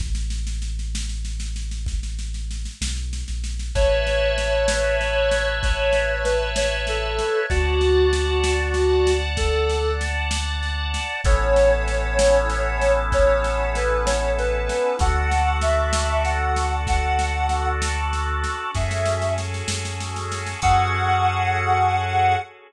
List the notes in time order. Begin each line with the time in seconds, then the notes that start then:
0.00 A1, kick, snare
0.15 snare
0.30 snare
0.47 snare
0.62 snare
0.79 snare
0.95 snare
1.09 snare
1.25 snare
1.40 snare
1.56 snare
1.71 snare
1.86 kick, snare
2.03 snare
2.19 snare
2.34 snare
2.51 snare
2.65 snare
2.81 B1, snare
2.96 snare
3.13 snare
3.28 A#1, snare
3.44 snare
3.59 snare
3.75 A1 B4 C#5 E5 A5, kick, snare
4.07 snare
4.38 snare
4.68 snare
5.01 snare
5.31 snare
5.63 C#5, kick, snare
5.93 snare
6.24 B4, snare
6.56 C#5, snare
6.87 A4, snare
7.19 snare
7.50 D2 F#4 D5 F#5 A5, kick, snare
7.81 snare
8.13 snare
8.44 snare
8.74 snare
9.07 snare
9.37 A4, kick, snare
9.70 snare
10.01 snare
10.31 snare
10.63 snare
10.94 snare
11.24 A1 B3 C#4 E4 A4 C#5, kick, snare
11.56 snare
11.88 snare
12.19 snare
12.50 snare
12.82 snare
13.12 C#5, kick, snare
13.44 snare
13.75 B4, snare
14.06 C#5, snare
14.39 B4, snare
14.69 snare
14.99 D2 D4 F#4 A4 F#5, kick, snare
15.31 snare
15.61 E5, snare
15.93 snare
16.24 F#5, snare
16.56 snare
16.87 F#5, kick, snare
17.19 snare
17.49 snare
17.82 snare
18.13 snare
18.44 snare
18.74 F#2 C#4 F#4 G#4 A4 E5, kick, snare
18.91 snare
19.05 snare
19.22 snare
19.38 snare
19.54 snare
19.68 F#2, snare
19.85 snare
20.00 snare
20.16 snare
20.32 snare
20.46 snare
20.62 F#2 C#4 F#4 G#4 A4 F#5, kick, crash